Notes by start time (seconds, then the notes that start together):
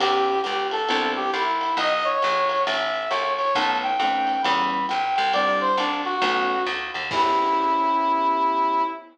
0.00 E2 B3 C#4 E4 G4, kick, ride
0.44 C#2 G4, hi-hat pedal, ride
0.71 A4, ride
0.89 C2 B3 C4 D4 E4, ride
1.16 G4
1.33 C2 E4, hi-hat pedal, ride
1.61 ride
1.77 B1 D#5, ride
2.04 C#5
2.22 A#1, hi-hat pedal, ride
2.49 ride
2.67 A1 E5, ride
3.10 C2 C#5, hi-hat pedal, ride
3.38 C#5, ride
3.55 B1 A3 B3 C#4 D#4 A5, kick, ride
3.83 G5
3.99 F2 A3 B3 C#4 D#4, hi-hat pedal, ride
4.27 ride
4.42 E2 G3 B3 C#4 E4 B5, ride
4.89 B1 G5, hi-hat pedal, ride
5.16 C2 G5, ride
5.33 G3 C4 D4 E4 D5, ride
5.61 C5
5.77 C2 D4, hi-hat pedal, ride
6.05 F#4, ride
6.22 B1 A3 B3 C#4 D#4, ride
6.66 D2, hi-hat pedal, ride
6.94 D#2, ride
7.11 E2 B3 C#4 E4 G4, kick, crash